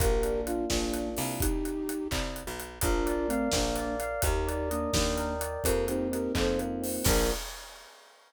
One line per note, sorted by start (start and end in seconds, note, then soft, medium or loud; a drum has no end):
0.00 0.64 A#1 medium
0.00 0.69 A#3 loud
0.00 0.41 G4 medium
0.00 0.41 A#4 loud
0.00 kick loud
0.00 closed hi-hat medium
0.23 0.94 D4 medium
0.23 closed hi-hat medium
0.46 0.66 D4 medium
0.46 0.66 F4 medium
0.46 1.17 F4 loud
0.46 closed hi-hat medium
0.70 1.15 A#1 medium
0.70 1.10 A#3 medium
0.70 1.37 A#3 medium
0.70 1.10 D4 medium
0.70 kick medium
0.70 snare medium
0.94 1.39 D4 medium
0.94 closed hi-hat medium
1.17 2.05 C2 medium
1.17 1.40 F4 medium
1.17 open hi-hat medium
1.40 2.08 D#4 medium
1.40 2.08 G4 loud
1.40 kick medium
1.40 closed hi-hat medium
1.65 closed hi-hat medium
1.89 closed hi-hat medium
2.11 2.43 C2 medium
2.11 kick medium
2.11 clap medium
2.36 closed hi-hat medium
2.47 2.79 B1 medium
2.60 closed hi-hat medium
2.81 3.46 A#1 medium
2.81 3.27 D4 loud
2.81 3.27 F4 loud
2.81 3.53 A#4 loud
2.81 kick medium
2.81 closed hi-hat medium
3.06 3.76 D5 loud
3.06 closed hi-hat medium
3.28 3.49 A3 medium
3.28 3.49 C4 loud
3.28 3.99 F5 medium
3.28 closed hi-hat medium
3.52 4.16 A#1 medium
3.52 3.96 A#3 medium
3.52 3.96 D4 medium
3.52 4.20 A#4 medium
3.52 kick medium
3.52 snare medium
3.76 4.21 D5 loud
3.76 closed hi-hat medium
4.00 4.22 F5 medium
4.00 closed hi-hat medium
4.22 4.87 D#2 loud
4.22 4.69 D#4 medium
4.22 4.69 G4 medium
4.22 5.16 A#4 loud
4.22 kick medium
4.22 closed hi-hat medium
4.47 5.41 D5 medium
4.47 closed hi-hat medium
4.70 4.91 A#3 medium
4.70 4.91 D4 medium
4.70 5.60 D#5 medium
4.70 closed hi-hat medium
4.93 5.58 D#2 medium
4.93 5.35 A#3 medium
4.93 5.35 D4 medium
4.93 5.61 G5 medium
4.93 kick medium
4.93 snare medium
5.17 5.62 A#4 loud
5.17 closed hi-hat medium
5.41 5.64 D5 medium
5.41 closed hi-hat medium
5.64 6.29 F2 medium
5.64 6.58 A#3 loud
5.64 5.85 G4 medium
5.64 5.85 A#4 medium
5.64 kick medium
5.64 closed hi-hat medium
5.88 6.82 C4 loud
5.88 6.08 D#4 medium
5.88 6.08 G4 medium
5.88 closed hi-hat medium
6.12 7.01 D#4 medium
6.12 6.33 G4 medium
6.12 6.33 A#4 medium
6.12 closed hi-hat medium
6.35 6.99 F2 medium
6.35 7.02 F4 medium
6.35 6.59 A4 medium
6.35 6.59 C5 medium
6.35 kick medium
6.35 clap medium
6.59 7.04 A#3 loud
6.59 closed hi-hat medium
6.82 7.04 C4 medium
6.82 open hi-hat medium
7.04 7.31 A#1 loud
7.04 7.30 A#3 loud
7.04 7.30 D4 loud
7.04 7.30 F4 loud
7.04 7.31 A#4 loud
7.04 kick loud
7.04 crash loud